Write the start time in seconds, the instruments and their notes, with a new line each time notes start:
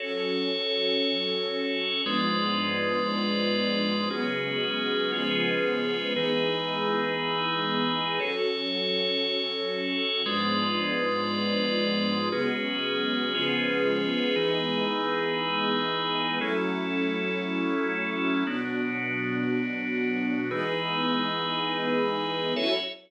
0.00 string ensemble 1 F#3 C#4 A4, drawbar organ F#4 A4 C#5
2.04 string ensemble 1 G#2 F3 B3 D4, drawbar organ G#3 F4 B4 D5
4.10 string ensemble 1 C#3 F#3 G#3 B3, drawbar organ C#4 F#4 G#4 B4
5.12 string ensemble 1 C#3 F3 G#3 B3, drawbar organ C#4 F4 G#4 B4
6.16 drawbar organ E3 D#4 G#4 B4, string ensemble 1 E3 G#3 B3 D#4
8.19 string ensemble 1 F#3 C#4 A4, drawbar organ F#4 A4 C#5
10.26 string ensemble 1 G#2 F3 B3 D4, drawbar organ G#3 F4 B4 D5
12.31 string ensemble 1 C#3 F#3 G#3 B3, drawbar organ C#4 F#4 G#4 B4
13.33 string ensemble 1 C#3 F3 G#3 B3, drawbar organ C#4 F4 G#4 B4
14.36 drawbar organ E3 D#4 G#4 B4, string ensemble 1 E3 G#3 B3 D#4
16.40 string ensemble 1 F#3 A3 C#4 E4, drawbar organ F#3 C#4 E4 A4
18.47 string ensemble 1 B2 F#3 D4, drawbar organ B3 D4 F#4
20.51 drawbar organ E3 D#4 G#4 B4, string ensemble 1 E3 G#3 B3 D#4
22.56 string ensemble 1 F#3 C#4 E4 A4, drawbar organ F#4 A4 C#5 E5